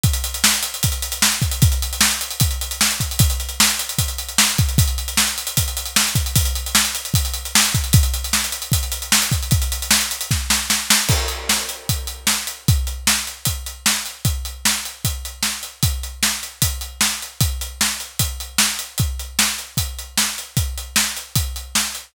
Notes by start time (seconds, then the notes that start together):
0.03 kick, closed hi-hat
0.13 closed hi-hat
0.24 closed hi-hat
0.34 closed hi-hat
0.44 snare
0.54 closed hi-hat
0.63 closed hi-hat
0.74 closed hi-hat
0.83 kick, closed hi-hat
0.92 closed hi-hat
1.02 closed hi-hat
1.12 closed hi-hat
1.22 snare
1.32 closed hi-hat
1.42 kick, closed hi-hat
1.51 closed hi-hat
1.62 kick, closed hi-hat
1.72 closed hi-hat
1.82 closed hi-hat
1.93 closed hi-hat
2.01 snare
2.11 closed hi-hat
2.21 closed hi-hat
2.31 closed hi-hat
2.40 kick, closed hi-hat
2.51 closed hi-hat
2.61 closed hi-hat
2.71 closed hi-hat
2.81 snare
2.91 closed hi-hat
3.00 kick, closed hi-hat
3.11 closed hi-hat
3.19 kick, closed hi-hat
3.30 closed hi-hat
3.40 closed hi-hat
3.49 closed hi-hat
3.60 snare
3.69 closed hi-hat
3.79 closed hi-hat
3.89 closed hi-hat
3.98 kick, closed hi-hat
4.08 closed hi-hat
4.18 closed hi-hat
4.29 closed hi-hat
4.38 snare
4.49 closed hi-hat
4.58 kick, closed hi-hat
4.69 closed hi-hat
4.78 kick, closed hi-hat
4.88 closed hi-hat
4.98 closed hi-hat
5.08 closed hi-hat
5.17 snare
5.27 closed hi-hat
5.38 closed hi-hat
5.47 closed hi-hat
5.57 kick, closed hi-hat
5.68 closed hi-hat
5.77 closed hi-hat
5.86 closed hi-hat
5.96 snare
6.07 closed hi-hat
6.15 kick, closed hi-hat
6.26 closed hi-hat
6.36 kick, closed hi-hat
6.45 closed hi-hat
6.55 closed hi-hat
6.66 closed hi-hat
6.75 snare
6.85 closed hi-hat
6.95 closed hi-hat
7.05 closed hi-hat
7.14 kick, closed hi-hat
7.25 closed hi-hat
7.34 closed hi-hat
7.45 closed hi-hat
7.55 snare
7.65 closed hi-hat
7.75 kick, closed hi-hat
7.84 closed hi-hat
7.93 kick, closed hi-hat
8.03 closed hi-hat
8.14 closed hi-hat
8.24 closed hi-hat
8.33 snare
8.44 closed hi-hat
8.52 closed hi-hat
8.62 closed hi-hat
8.72 kick, closed hi-hat
8.83 closed hi-hat
8.92 closed hi-hat
9.02 closed hi-hat
9.12 snare
9.22 closed hi-hat
9.32 kick, closed hi-hat
9.43 closed hi-hat
9.51 kick, closed hi-hat
9.62 closed hi-hat
9.72 closed hi-hat
9.82 closed hi-hat
9.91 snare
10.01 closed hi-hat
10.11 closed hi-hat
10.21 closed hi-hat
10.31 kick, snare
10.50 snare
10.70 snare
10.90 snare
11.09 kick, crash
11.28 closed hi-hat
11.49 snare
11.69 closed hi-hat
11.89 kick, closed hi-hat
12.07 closed hi-hat
12.27 snare
12.47 closed hi-hat
12.68 kick, closed hi-hat
12.87 closed hi-hat
13.07 snare
13.27 closed hi-hat
13.45 kick, closed hi-hat
13.66 closed hi-hat
13.86 snare
14.06 closed hi-hat
14.25 kick, closed hi-hat
14.45 closed hi-hat
14.65 snare
14.85 closed hi-hat
15.05 kick, closed hi-hat
15.25 closed hi-hat
15.43 snare
15.63 closed hi-hat
15.83 kick, closed hi-hat
16.03 closed hi-hat
16.23 snare
16.43 closed hi-hat
16.62 kick, closed hi-hat
16.81 closed hi-hat
17.01 snare
17.22 closed hi-hat
17.41 kick, closed hi-hat
17.61 closed hi-hat
17.81 snare
18.00 closed hi-hat
18.19 kick, closed hi-hat
18.40 closed hi-hat
18.58 snare
18.79 closed hi-hat
18.98 kick, closed hi-hat
19.19 closed hi-hat
19.39 snare
19.58 closed hi-hat
19.77 kick, closed hi-hat
19.99 closed hi-hat
20.18 snare
20.38 closed hi-hat
20.57 kick, closed hi-hat
20.78 closed hi-hat
20.96 snare
21.17 closed hi-hat
21.36 kick, closed hi-hat
21.56 closed hi-hat
21.75 snare
21.95 closed hi-hat